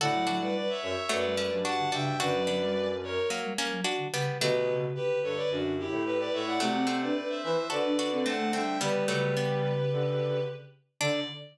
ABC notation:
X:1
M:4/4
L:1/16
Q:1/4=109
K:D
V:1 name="Violin"
[df]3 [Bd] [Bd] [ce] [ce]2 [Bd]4 [fa]2 [eg]2 | [Bd]6 [^Ac]2 z8 | [GB]3 z [GB]2 [Ac] [Bd] [DF]2 [EG]2 [GB] [Bd] [ce] [df] | [df]3 [Bd] [Bd] [=ce] [ce]2 [Bd]4 [fa]2 [eg]2 |
[GB]2 [GB]10 z4 | d4 z12 |]
V:2 name="Pizzicato Strings"
[FA]2 [DF]6 [F,A,]2 [A,C]2 [DF]2 [DF]2 | [DF]2 [B,D]6 [F,^A,]2 [A,C]2 [DF]2 [G,B,]2 | [F,A,]4 z12 | [F,A,]2 [A,=C]6 [FA]2 [DF]2 [A,C]2 [A,C]2 |
[G,B,]2 [F,A,]2 [G,B,]6 z6 | D4 z12 |]
V:3 name="Ocarina"
D, F, F, G, z5 G, G, F, z D, C, z | D, F, F, G, z5 G, G, F, z D, C, z | D,2 C,2 D,6 z6 | A, =C C D z5 D D C z A, G, z |
D, D, C,10 z4 | D,4 z12 |]
V:4 name="Flute" clef=bass
A,,4 z2 F,, z F,,3 G,,3 G,,2 | F,,8 z8 | B,,4 z2 G,, z F,,3 A,,3 A,,2 | =C,4 z2 E, z D,3 D,3 D,2 |
G,8 D,4 z4 | D,4 z12 |]